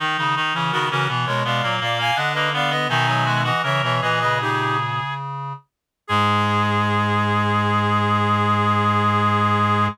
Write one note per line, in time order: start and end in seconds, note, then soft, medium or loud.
0.00 0.17 D#3 loud
0.00 0.17 D#3 medium
0.00 0.17 D#4 loud
0.18 0.35 C#3 medium
0.18 0.35 D#3 medium
0.18 0.35 D#4 medium
0.36 0.53 D#3 medium
0.36 0.54 D#4 loud
0.54 0.71 C#3 medium
0.54 0.71 E3 medium
0.54 0.72 C#4 medium
0.71 0.89 C#3 medium
0.71 0.89 D#3 medium
0.71 0.90 B3 medium
0.71 0.88 F#4 medium
0.71 0.88 A#4 medium
0.89 1.08 C#3 medium
0.89 1.07 E3 medium
0.89 1.08 C#4 loud
0.89 1.08 F#4 medium
0.89 1.08 A#4 medium
1.08 1.26 B2 medium
1.08 1.26 E3 medium
1.08 1.40 B3 medium
1.26 1.44 B2 medium
1.26 1.44 G#3 medium
1.26 1.43 A#4 medium
1.26 1.43 C#5 medium
1.44 1.62 B2 medium
1.44 1.62 G#3 medium
1.44 1.62 B3 medium
1.44 1.75 D5 medium
1.44 1.75 F5 medium
1.63 1.80 A#2 medium
1.63 1.80 F#3 medium
1.63 1.80 A#3 loud
1.81 2.11 A#2 medium
1.81 1.98 A#3 loud
1.81 1.99 D5 medium
1.81 1.99 F5 medium
1.98 2.16 A#3 loud
1.98 2.17 F5 medium
1.98 2.17 G#5 medium
2.15 2.87 D3 medium
2.15 2.34 D4 medium
2.15 2.49 D4 medium
2.15 2.33 D#5 medium
2.15 2.33 F#5 medium
2.33 2.53 A#3 loud
2.33 2.50 B4 medium
2.33 2.50 D#5 medium
2.53 2.70 B3 loud
2.53 2.71 B3 medium
2.53 2.71 D5 medium
2.53 2.71 F5 medium
2.70 2.88 B3 loud
2.70 2.89 B3 medium
2.70 2.88 B4 medium
2.70 2.88 D#5 medium
2.89 3.51 B2 medium
2.89 3.06 D#3 medium
2.89 3.51 D#3 medium
2.89 3.07 D#4 loud
2.89 3.42 E5 medium
2.89 3.42 G#5 medium
3.06 3.24 F#3 medium
3.06 3.25 D#4 medium
3.25 3.43 G#3 medium
3.25 3.43 F#4 medium
3.44 3.62 E3 medium
3.44 3.62 F#4 loud
3.44 3.62 D#5 medium
3.44 3.62 F#5 medium
3.63 3.81 C#3 medium
3.63 3.81 E3 medium
3.63 3.94 A#4 medium
3.63 3.82 C#5 medium
3.63 3.82 E5 medium
3.82 4.01 B2 medium
3.82 4.01 E3 medium
3.82 4.01 C#5 medium
3.82 4.01 E5 medium
4.01 5.01 A#2 medium
4.01 4.20 E3 medium
4.01 5.14 G#4 loud
4.01 4.19 B4 medium
4.01 4.19 D#5 medium
4.20 4.40 C#3 medium
4.20 4.38 B4 medium
4.20 4.38 D#5 medium
4.40 5.53 C#3 medium
4.40 4.77 D#4 medium
4.40 4.77 G4 medium
6.07 9.88 G#2 loud
6.07 9.88 G#3 loud
6.07 9.86 G#4 loud
6.07 9.88 G#4 loud